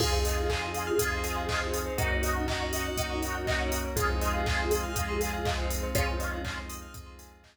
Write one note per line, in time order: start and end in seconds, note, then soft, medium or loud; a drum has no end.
0.00 0.91 F2 loud
0.00 0.45 C4 loud
0.00 0.99 C4 medium
0.00 0.45 D#4 loud
0.00 0.99 D#4 medium
0.00 0.45 F4 loud
0.00 1.79 F4 medium
0.00 0.99 F4 medium
0.00 0.11 G#4 loud
0.00 0.45 G#4 loud
0.00 1.79 G#4 medium
0.00 0.99 G#4 medium
0.00 kick loud
0.00 crash loud
0.13 0.24 C5 medium
0.25 0.36 D#5 medium
0.25 open hi-hat loud
0.37 0.48 F5 medium
0.50 0.94 C4 medium
0.50 0.94 D#4 medium
0.50 0.94 F4 medium
0.50 0.94 G#4 medium
0.50 0.61 G#5 medium
0.50 kick medium
0.50 clap loud
0.62 0.73 C6 medium
0.74 0.86 D#6 medium
0.74 open hi-hat medium
0.87 0.98 F6 medium
0.98 1.89 F2 medium
0.98 1.44 C4 medium
0.98 1.98 C4 medium
0.98 1.44 D#4 loud
0.98 1.98 D#4 medium
0.98 1.44 F4 loud
0.98 1.44 G#4 medium
0.98 1.98 G#4 medium
0.98 1.98 C5 medium
0.98 1.10 D#6 medium
0.98 kick loud
0.98 closed hi-hat loud
1.11 1.23 C6 medium
1.24 1.35 G#5 medium
1.24 open hi-hat medium
1.36 1.47 F5 medium
1.49 1.93 C4 medium
1.49 1.93 D#4 medium
1.49 1.93 F4 medium
1.49 1.93 G#4 medium
1.49 1.60 D#5 medium
1.49 kick loud
1.49 clap loud
1.61 1.72 C5 medium
1.74 1.85 G#4 medium
1.74 open hi-hat loud
1.86 1.97 C5 medium
1.98 2.89 F#2 loud
1.98 2.43 A#3 loud
1.98 2.97 A#3 medium
1.98 2.43 C#4 loud
1.98 2.97 C#4 medium
1.98 3.79 D#4 medium
1.98 2.43 D#4 loud
1.98 2.97 D#4 medium
1.98 3.79 F#4 loud
1.98 2.43 F#4 loud
1.98 2.97 F#4 medium
1.98 2.09 A#4 loud
1.98 kick loud
1.98 closed hi-hat loud
2.11 2.22 C#5 medium
2.23 2.34 D#5 medium
2.23 open hi-hat loud
2.36 2.47 F#5 medium
2.48 2.93 A#3 loud
2.48 2.93 C#4 medium
2.48 2.93 D#4 medium
2.48 2.93 F#4 medium
2.48 2.59 A#5 medium
2.48 kick loud
2.48 clap loud
2.60 2.71 C#6 medium
2.73 2.84 D#6 medium
2.73 open hi-hat loud
2.85 2.96 F#6 medium
2.96 3.88 F#2 medium
2.96 3.96 A#3 medium
2.96 3.42 A#3 medium
2.96 3.96 C#4 medium
2.96 3.42 C#4 medium
2.96 3.42 D#4 medium
2.96 3.96 F#4 medium
2.96 3.42 F#4 medium
2.96 3.96 A#4 medium
2.96 3.08 D#6 medium
2.96 kick loud
2.96 closed hi-hat loud
3.10 3.21 C#6 medium
3.22 3.33 A#5 medium
3.22 open hi-hat medium
3.35 3.46 F#5 medium
3.47 3.92 A#3 medium
3.47 3.92 C#4 medium
3.47 3.92 D#4 medium
3.47 3.92 F#4 medium
3.47 3.58 D#5 medium
3.47 kick loud
3.47 clap loud
3.60 3.71 C#5 medium
3.72 3.83 A#4 medium
3.72 open hi-hat loud
3.84 3.96 C#5 medium
3.96 4.87 F2 medium
3.96 4.94 G#3 medium
3.96 4.41 G#3 loud
3.96 4.94 C4 medium
3.96 4.41 C4 loud
3.96 4.94 D#4 medium
3.96 4.41 D#4 loud
3.96 4.94 F4 medium
3.96 5.62 F4 medium
3.96 4.41 F4 loud
3.96 5.62 G#4 loud
3.96 4.08 G#4 loud
3.96 kick loud
3.96 closed hi-hat loud
4.09 4.20 C5 medium
4.21 4.33 D#5 medium
4.21 open hi-hat medium
4.34 4.45 F5 medium
4.46 4.91 G#3 medium
4.46 4.91 C4 medium
4.46 4.91 D#4 loud
4.46 4.91 F4 medium
4.46 4.58 G#5 medium
4.46 kick loud
4.46 clap loud
4.59 4.70 C6 medium
4.71 4.82 D#6 medium
4.71 open hi-hat loud
4.83 4.95 F6 medium
4.96 5.87 F2 medium
4.96 5.40 G#3 medium
4.96 5.95 G#3 medium
4.96 5.40 C4 medium
4.96 5.95 C4 medium
4.96 5.40 D#4 medium
4.96 5.40 F4 medium
4.96 5.95 F4 medium
4.96 5.95 G#4 medium
4.96 5.07 D#6 medium
4.96 kick loud
4.96 closed hi-hat loud
5.08 5.20 C6 medium
5.21 5.32 G#5 medium
5.21 open hi-hat loud
5.33 5.44 F5 medium
5.45 5.90 G#3 medium
5.45 5.90 C4 loud
5.45 5.90 D#4 medium
5.45 5.90 F4 medium
5.45 5.56 D#5 medium
5.45 kick loud
5.45 clap loud
5.58 5.69 C5 medium
5.70 5.81 G#4 medium
5.70 open hi-hat loud
5.83 5.94 C5 medium
5.95 6.87 F2 medium
5.95 6.40 G#3 loud
5.95 6.93 G#3 medium
5.95 6.40 C4 loud
5.95 6.93 C4 medium
5.95 6.61 C#4 medium
5.95 6.40 D#4 loud
5.95 6.94 D#4 medium
5.95 6.40 F4 loud
5.95 6.61 F4 loud
5.95 6.93 F4 medium
5.95 6.06 G#4 loud
5.95 kick loud
5.95 closed hi-hat loud
6.08 6.19 C5 medium
6.20 6.31 D#5 medium
6.20 open hi-hat medium
6.32 6.43 F5 medium
6.45 6.89 G#3 medium
6.45 6.89 C4 loud
6.45 6.89 D#4 medium
6.45 6.89 F4 medium
6.45 6.56 G#5 medium
6.45 kick loud
6.45 clap loud
6.57 6.68 C6 medium
6.69 6.80 D#6 medium
6.69 open hi-hat loud
6.82 6.93 F6 medium
6.94 7.57 F2 medium
6.94 7.57 G#3 medium
6.94 7.39 G#3 medium
6.94 7.57 C4 medium
6.94 7.39 C4 medium
6.94 7.39 D#4 loud
6.94 7.57 F4 medium
6.94 7.39 F4 medium
6.94 7.57 G#4 medium
6.94 7.05 D#6 medium
6.94 kick loud
6.94 closed hi-hat loud
7.06 7.18 C6 medium
7.19 7.30 G#5 medium
7.19 open hi-hat loud
7.32 7.43 F5 medium
7.44 7.57 G#3 medium
7.44 7.57 C4 medium
7.44 7.57 D#4 medium
7.44 7.57 F4 medium
7.44 7.55 D#5 medium
7.44 kick medium
7.44 clap loud